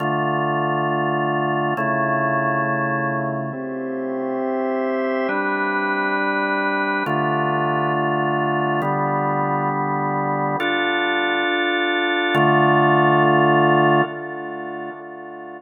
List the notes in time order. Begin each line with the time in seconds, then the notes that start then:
0.00 D3 A3 F4
1.77 C#3 A3 E4
3.53 C4 G4 E5
5.29 G3 D4 B4
7.06 D3 A3 F4
8.82 D3 G3 B3
10.60 D4 F4 A4
12.35 D3 A3 F4